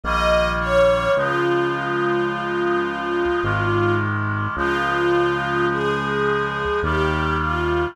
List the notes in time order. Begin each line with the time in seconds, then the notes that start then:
0.04 A#1 D#3 G3 A#3 D#5
0.60 C#5
1.17 C#2 C#3 F3 G#3 F4
3.43 G#1 C3 D#3 G#3
4.56 C#2 C#3 F3 G#3 F4
5.70 G#4
6.83 D#2 C3 D#3 G3 G4
7.40 F4